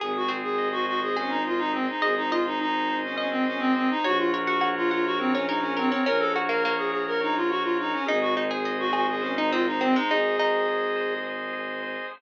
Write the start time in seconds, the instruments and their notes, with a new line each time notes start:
0.00 violin G#1, clarinet G#4, drawbar organ G#4, pizzicato strings G#4
0.17 clarinet F#4
0.28 pizzicato strings C4, drawbar organ C5
0.44 clarinet G#4
0.58 drawbar organ D#5
0.72 clarinet F#4
0.85 clarinet F#4, drawbar organ G#4
1.03 clarinet G#4
1.16 clarinet C#4, pizzicato strings G#4, drawbar organ C5
1.29 clarinet D#4
1.45 clarinet F4, drawbar organ D#5
1.58 clarinet D#4
1.73 clarinet C4, drawbar organ G#4
1.89 clarinet D#4
2.01 violin G#1, clarinet G#4, drawbar organ C5, pizzicato strings D#5
2.17 clarinet D#4
2.30 clarinet F4, drawbar organ D#5, pizzicato strings D#5
2.47 clarinet D#4
2.59 clarinet D#4, drawbar organ G#4
2.89 drawbar organ C5
3.04 clarinet C#4
3.16 clarinet C#4, drawbar organ D#5, pizzicato strings D#5
3.31 clarinet C4
3.45 clarinet C#4, drawbar organ G#4
3.59 clarinet C4
3.76 clarinet C4, drawbar organ C5
3.91 clarinet D#4
4.04 violin A#1, drawbar organ F#4, clarinet F#4, pizzicato strings C#5
4.18 clarinet F4
4.32 drawbar organ A#4, pizzicato strings C#5
4.45 clarinet F#4, pizzicato strings F#5
4.61 drawbar organ C#5, pizzicato strings F#5
4.77 clarinet F4
4.90 clarinet F4, drawbar organ F#4, pizzicato strings F#5
5.05 clarinet F#4
5.19 clarinet C4, drawbar organ A#4
5.32 clarinet C#4, pizzicato strings C#5
5.47 clarinet D#4, pizzicato strings A#4, drawbar organ C#5
5.60 clarinet C#4
5.77 clarinet C4, drawbar organ F#4, pizzicato strings A#4
5.90 clarinet C4, pizzicato strings C#4
6.05 violin A#1, pizzicato strings C#4, clarinet A#4, drawbar organ A#4
6.19 clarinet A4
6.36 pizzicato strings F#4, drawbar organ C#5
6.49 pizzicato strings A#3, clarinet A#4
6.63 pizzicato strings A#3, drawbar organ F#4
6.77 clarinet G#4
6.92 clarinet G#4, drawbar organ A#4
7.07 clarinet A#4
7.21 clarinet D#4, drawbar organ C#5
7.36 clarinet F4
7.49 drawbar organ F#4, clarinet F#4
7.63 clarinet F4
7.79 clarinet D#4, drawbar organ A#4
7.93 clarinet C#4
8.05 violin G#1, pizzicato strings D#4, clarinet G#4, drawbar organ G#4
8.21 clarinet F#4
8.37 pizzicato strings D#4, drawbar organ C5
8.51 pizzicato strings G#4, clarinet G#4
8.65 pizzicato strings G#4, drawbar organ D#5
8.79 clarinet F#4
8.93 clarinet F#4, pizzicato strings G#4, drawbar organ G#4
9.09 clarinet G#4
9.21 clarinet C#4, drawbar organ C5
9.36 clarinet D#4, pizzicato strings D#4
9.51 pizzicato strings C4, clarinet F4, drawbar organ D#5
9.67 clarinet D#4
9.81 pizzicato strings C4, clarinet C4, drawbar organ G#4
9.96 pizzicato strings G#3, clarinet D#4
10.09 violin G#1, pizzicato strings D#4, clarinet G#4, drawbar organ C5
10.38 pizzicato strings D#4, drawbar organ D#5
10.68 drawbar organ G#4
10.96 drawbar organ C5
11.24 drawbar organ D#5
11.53 drawbar organ G#4
11.83 drawbar organ C5